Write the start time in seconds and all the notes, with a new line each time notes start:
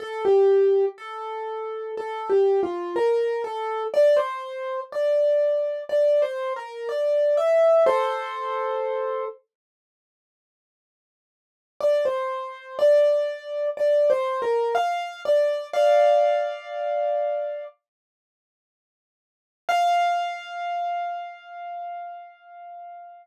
0.00 A4
0.25 G4
0.98 A4
1.97 A4
2.30 G4
2.63 F4
2.96 A#4
3.44 A4
3.94 D5
4.17 C5
4.92 D5
5.89 D5
6.22 C5
6.56 A#4
6.89 D5
7.37 E5
7.86 A4 C5
11.81 D5
12.05 C5
12.79 D5
13.77 D5
14.10 C5
14.42 A#4
14.75 F5
15.25 D5
15.73 D5 F5
19.69 F5